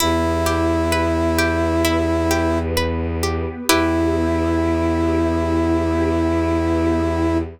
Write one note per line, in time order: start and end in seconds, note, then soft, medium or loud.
0.00 3.40 E2 loud
0.00 1.82 B3 medium
0.00 1.82 E4 medium
0.00 2.58 E4 loud
0.00 0.42 E4 medium
0.00 1.82 G4 medium
0.46 0.88 G4 medium
0.92 1.34 B4 medium
1.38 1.80 G4 medium
1.84 3.67 B3 medium
1.84 2.26 E4 medium
1.84 3.67 G4 medium
1.84 3.67 B4 medium
2.31 2.72 G4 medium
2.77 3.18 B4 medium
3.23 3.65 G4 medium
3.69 7.37 E2 loud
3.69 7.37 B3 loud
3.69 7.37 E4 loud
3.69 7.38 E4 medium
3.69 7.38 E4 loud
3.69 7.37 G4 loud
3.69 7.38 G4 loud
3.69 7.38 B4 loud